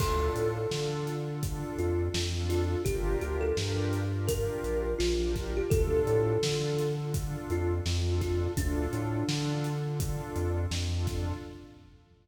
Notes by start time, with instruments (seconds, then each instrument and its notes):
0.00 synth bass 1 D2, pad 2 (warm) D4 F4 A4, kalimba A4, kick, crash
0.36 synth bass 1 A2, closed hi-hat
0.71 synth bass 1 D3, pad 2 (warm) D4 F4 A4, snare
1.07 closed hi-hat
1.27 pad 2 (warm) D4 F4 A4
1.43 pad 2 (warm) D4 F4 A4, kick, closed hi-hat
1.78 synth bass 1 F2, kalimba F4, closed hi-hat
2.14 synth bass 1 F2, snare
2.34 pad 2 (warm) D4 F4 A4
2.49 kalimba F4, snare, closed hi-hat
2.85 synth bass 1 G1, pad 2 (warm) D4 F4 G4 A#4, kalimba G4, kick, closed hi-hat
3.21 synth bass 1 D2, kalimba G4, closed hi-hat
3.41 kalimba A4
3.57 synth bass 1 G2, pad 2 (warm) D4 F4 G4 A#4, snare
3.93 closed hi-hat
4.14 pad 2 (warm) D4 F4 G4 A#4
4.27 pad 2 (warm) D4 F4 G4 A#4, kalimba A#4, kick, closed hi-hat
4.64 synth bass 1 A#1, closed hi-hat
4.99 synth bass 1 A#1, kalimba F4, snare
5.19 pad 2 (warm) D4 F4 G4 A#4
5.36 kick, snare, closed hi-hat
5.57 kalimba G4
5.70 synth bass 1 D2, pad 2 (warm) D4 F4 A4, kalimba A4, kick, closed hi-hat
6.07 synth bass 1 A2, closed hi-hat
6.42 synth bass 1 D3, pad 2 (warm) D4 F4 A4, snare
6.79 closed hi-hat
6.97 pad 2 (warm) D4 F4 A4
7.14 pad 2 (warm) D4 F4 A4, kick, closed hi-hat
7.50 synth bass 1 F2, kalimba F4, closed hi-hat
7.86 synth bass 1 F2, snare
8.06 pad 2 (warm) D4 F4 A4
8.21 kalimba F4, kick, snare, closed hi-hat
8.57 synth bass 1 D2, pad 2 (warm) D4 F4 A4, kalimba D4, kick, closed hi-hat
8.93 synth bass 1 A2, closed hi-hat
9.28 synth bass 1 D3, pad 2 (warm) D4 F4 A4, snare
9.64 closed hi-hat
9.85 pad 2 (warm) D4 F4 A4
10.00 pad 2 (warm) D4 F4 A4, kick, closed hi-hat
10.36 synth bass 1 F2, closed hi-hat
10.71 synth bass 1 F2, snare
10.91 pad 2 (warm) D4 F4 A4
11.07 kick, snare, closed hi-hat